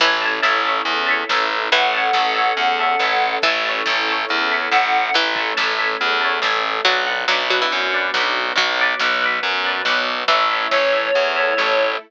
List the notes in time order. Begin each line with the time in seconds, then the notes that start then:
0.00 A1 E3 C#4 E4 A4 E5 A5, kick, crash
0.04 C#5
0.22 C#5 E5 A5
0.42 A1 C#5 E5 A5, snare
0.65 C#5 E5 A5
0.85 E2, closed hi-hat
1.07 C#5 E5 A5
1.29 A1 C#5 E5 A5, snare
1.72 A1 E3 A3 C#4 A4 F#5, kick, closed hi-hat
1.93 C#5 E5 A5
2.13 A1 E5 A5, snare
2.17 C#5
2.34 C#5 E5 A5
2.57 E2, closed hi-hat
2.79 C#5 E5 A5
2.99 A1 E5 A5, snare
3.04 C#5
3.42 A1 E3 C#4 E4 A4 E5 A5, kick, closed hi-hat
3.47 C#5
3.65 C#5 E5 A5
3.86 A1 C#5 E5 A5, snare
4.08 C#5 E5 A5
4.29 E2, closed hi-hat
4.50 C#5 E5 A5
4.71 A1 E5 F#5 A5, snare
4.76 C#5
5.13 A1 E3 A3 C#4 A4, closed hi-hat
5.36 E5 A5, kick
5.40 C#5
5.57 A1 C#5 E5 A5, snare
5.77 C#5 E5 A5
6.01 E2, closed hi-hat
6.21 C#5 E5 A5
6.42 A1 E5 A5, snare
6.46 C#5
6.85 B1 F#3 B3 D4 F#4 D5 F#5, kick, closed hi-hat
6.90 B4
7.07 B4 D5 F#5
7.28 B1 F#3 D5 F#5, snare
7.32 B4
7.50 F#3 B4 D5 F#5
7.62 E3
7.70 F#2, closed hi-hat
7.92 B4 D5 F#5
8.14 B1 D5 F#5, snare
8.19 B4
8.56 B1 F#3 B3 F#4, kick, closed hi-hat
8.79 B4 D5 F#5
9.00 B1 D5 F#5, snare
9.04 B4
9.22 B4 D5 F#5
9.43 F#2, closed hi-hat
9.64 B4 D5 F#5
9.85 B1 D5 F#5, snare
9.90 B4
10.28 A1 E3 A3 C#4 E4 C#5 E5, kick, closed hi-hat
10.34 A4
10.51 A4 C#5 E5
10.71 A1 C#5 E5, snare
10.75 A4
10.93 A4 C#5 E5
11.15 E2 A3 E4 A4, closed hi-hat
11.36 A4 C#5 E5
11.57 A1 A4 C#5 E5, snare